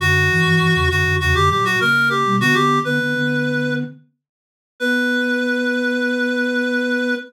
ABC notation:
X:1
M:4/4
L:1/16
Q:1/4=100
K:Bm
V:1 name="Clarinet"
F6 F2 F G G F ^A2 G2 | F G2 B7 z6 | B16 |]
V:2 name="Flute"
[F,,D,]2 [G,,E,] [G,,E,] [G,,E,] [E,,C,] [F,,D,] [F,,D,] [E,,C,] [F,,D,] [^A,,F,]2 [C,^A,]3 [B,,G,] | [D,B,] [D,B,]2 [D,B,] [D,B,] [D,B,]5 z6 | B,16 |]